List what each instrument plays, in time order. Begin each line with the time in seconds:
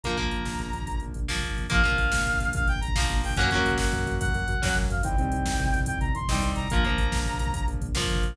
0.03 synth bass 1 A#1, overdriven guitar F3 A#3, brass section A#5, kick, closed hi-hat
0.10 kick
0.17 synth bass 1 A#1, overdriven guitar F3 A#3, kick, closed hi-hat
0.24 kick
0.31 synth bass 1 A#1, kick, closed hi-hat
0.40 kick
0.45 synth bass 1 A#1, kick, snare
0.52 kick
0.59 synth bass 1 A#1, kick, closed hi-hat
0.66 kick
0.73 synth bass 1 A#1, kick, closed hi-hat
0.82 kick
0.87 synth bass 1 A#1, kick, closed hi-hat
0.95 kick
1.00 synth bass 1 A#1, kick, closed hi-hat
1.08 kick
1.14 synth bass 1 A#1, kick, closed hi-hat
1.23 kick
1.28 synth bass 1 A#1, overdriven guitar F3 A#3, kick, snare
1.36 kick
1.42 synth bass 1 A#1, kick, closed hi-hat
1.49 kick
1.57 synth bass 1 A#1, kick, closed hi-hat
1.64 kick
1.70 synth bass 1 A#1, overdriven guitar F3 A#3, brass section F5, kick, closed hi-hat
1.76 kick
1.84 synth bass 1 A#1, overdriven guitar F3 A#3, kick, closed hi-hat
1.91 kick
1.98 synth bass 1 A#1, kick, closed hi-hat
2.06 kick
2.12 synth bass 1 A#1, kick, snare
2.20 kick
2.26 synth bass 1 A#1, kick, closed hi-hat
2.33 kick
2.40 synth bass 1 A#1, kick, closed hi-hat
2.47 kick
2.53 synth bass 1 A#1, brass section F5, kick, closed hi-hat
2.60 kick
2.67 synth bass 1 A#1, brass section G5, kick, closed hi-hat
2.75 kick
2.81 synth bass 1 A#1, brass section A#5, kick, closed hi-hat
2.88 kick
2.95 synth bass 1 A#1, overdriven guitar F3 A#3, kick, snare
3.02 kick
3.09 synth bass 1 A#1, kick, closed hi-hat
3.16 kick
3.23 synth bass 1 A#1, brass section G5, kick, open hi-hat
3.30 kick
3.36 synth bass 1 F#2, overdriven guitar A#3 C#4, brass section F#5, kick, closed hi-hat
3.41 overdriven guitar F#3, kick
3.51 synth bass 1 F#2, overdriven guitar A#3 C#4, kick, closed hi-hat
3.55 overdriven guitar F#3, kick
3.65 synth bass 1 F#2, kick, closed hi-hat
3.72 kick
3.78 synth bass 1 F#2, brass section F#5, kick, snare
3.86 kick
3.92 synth bass 1 F#2, kick, closed hi-hat
3.99 kick
4.06 synth bass 1 F#2, kick, closed hi-hat
4.13 kick
4.20 synth bass 1 F#2, brass section F#5, kick, closed hi-hat
4.28 kick
4.34 synth bass 1 F#2, kick, closed hi-hat
4.41 kick
4.48 synth bass 1 F#2, kick, closed hi-hat
4.54 kick
4.62 synth bass 1 F#2, overdriven guitar F#3 A#3 C#4, kick, snare
4.69 kick
4.76 synth bass 1 F#2, kick, closed hi-hat
4.83 kick
4.90 synth bass 1 F#2, brass section F5, kick, closed hi-hat
4.97 kick
5.03 synth bass 1 C2, overdriven guitar G3 C4 D#4, brass section G5, kick, closed hi-hat
5.12 kick
5.18 synth bass 1 C2, overdriven guitar G3 C4 D#4, kick, closed hi-hat
5.25 kick
5.32 synth bass 1 C2, kick, closed hi-hat
5.39 kick
5.46 synth bass 1 C2, kick, snare
5.52 kick
5.59 synth bass 1 C2, kick, closed hi-hat
5.66 kick
5.73 synth bass 1 C2, kick, closed hi-hat
5.80 kick
5.86 synth bass 1 C2, brass section G5, kick, closed hi-hat
5.94 kick
6.01 synth bass 1 C2, brass section A#5, kick, closed hi-hat
6.09 kick
6.15 synth bass 1 C2, brass section C6, kick, closed hi-hat
6.21 kick
6.28 synth bass 1 C2, overdriven guitar C4 D#4, kick, snare
6.32 overdriven guitar G3, kick
6.42 synth bass 1 C2, kick, closed hi-hat
6.50 kick
6.56 synth bass 1 C2, brass section A#5, kick, closed hi-hat
6.64 kick
6.70 synth bass 1 A#1, overdriven guitar F3 A#3, brass section A#5, kick, closed hi-hat
6.77 kick
6.83 synth bass 1 A#1, overdriven guitar F3 A#3, kick, closed hi-hat
6.91 kick
6.98 synth bass 1 A#1, kick, closed hi-hat
7.06 kick
7.12 synth bass 1 A#1, kick, snare
7.19 kick
7.26 synth bass 1 A#1, kick, closed hi-hat
7.33 kick
7.39 synth bass 1 A#1, kick, closed hi-hat
7.46 kick
7.54 synth bass 1 A#1, kick, closed hi-hat
7.61 kick
7.67 synth bass 1 A#1, kick, closed hi-hat
7.74 kick
7.81 synth bass 1 A#1, kick, closed hi-hat
7.88 kick
7.95 synth bass 1 A#1, overdriven guitar F3 A#3, kick, snare
8.02 kick
8.09 synth bass 1 A#1, kick, closed hi-hat
8.16 kick
8.23 synth bass 1 A#1, kick, closed hi-hat
8.30 kick